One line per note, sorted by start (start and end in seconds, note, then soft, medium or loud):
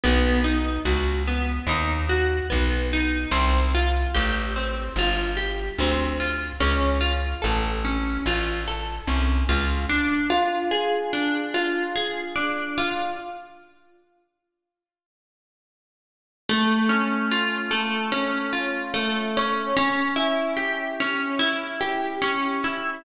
0.04 0.79 B1 medium
0.04 0.41 B3 medium
0.44 0.81 D#4 medium
0.85 1.59 C#2 medium
0.85 1.22 F#4 medium
1.27 1.64 B3 medium
1.67 2.41 D#2 medium
1.67 2.06 D#4 medium
2.09 2.46 F#4 medium
2.50 3.26 B1 medium
2.50 2.87 B3 soft
2.93 3.30 D#4 medium
3.31 4.05 C2 medium
3.31 3.68 C4 medium
3.74 4.11 F4 medium
4.14 4.89 A1 medium
4.14 4.51 G4 medium
4.56 4.93 C4 medium
4.96 5.70 G1 medium
4.96 5.35 F4 medium
5.37 5.74 G4 medium
5.78 6.52 D2 medium
5.78 6.17 C4 medium
6.20 6.57 F4 medium
6.60 7.34 C#2 medium
6.60 6.97 C#4 medium
7.01 7.38 F4 medium
7.42 8.18 A1 medium
7.42 7.79 A4 medium
7.85 8.22 C#4 medium
8.26 9.00 A1 medium
8.26 8.64 F4 medium
8.67 9.04 A4 medium
9.07 9.44 C2 medium
9.07 9.45 C#4 medium
9.49 9.86 C#2 medium
9.49 9.86 F4 soft
9.89 11.13 D4 medium
10.30 11.54 F4 medium
10.71 11.95 G#4 medium
11.13 12.35 D4 medium
11.54 12.77 F4 medium
11.96 13.13 G#4 medium
12.35 13.14 D4 medium
12.78 13.17 F4 medium
16.49 17.70 A3 loud
16.89 18.11 C#4 medium
17.31 18.52 F4 medium
17.71 18.93 A3 medium
18.12 19.36 C#4 medium
18.53 19.70 F4 medium
18.94 19.72 A3 medium
19.37 19.76 C#4 medium
19.77 21.00 C#4 loud
20.16 21.39 E4 medium
20.57 21.80 G4 medium
21.00 22.21 C#4 medium
21.39 22.64 E4 medium
21.81 22.98 G4 medium
22.22 23.00 C#4 medium
22.64 23.03 E4 medium